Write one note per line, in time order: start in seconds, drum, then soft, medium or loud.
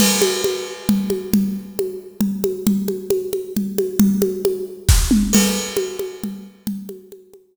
0.00 crash medium
0.00 low conga medium
0.22 high conga medium
0.44 high conga medium
0.89 low conga medium
1.10 high conga medium
1.33 low conga medium
1.79 high conga medium
2.21 low conga medium
2.44 high conga medium
2.67 low conga medium
2.88 high conga medium
3.10 high conga medium
3.33 high conga medium
3.57 low conga medium
3.78 high conga medium
3.99 low conga medium
4.22 high conga medium
4.45 high conga medium
4.89 kick medium
4.89 snare medium
5.11 mid tom medium
5.33 crash medium
5.33 low conga medium
5.77 high conga medium
5.99 high conga medium
6.24 low conga medium
6.67 low conga medium
6.89 high conga medium
7.12 high conga medium
7.34 high conga medium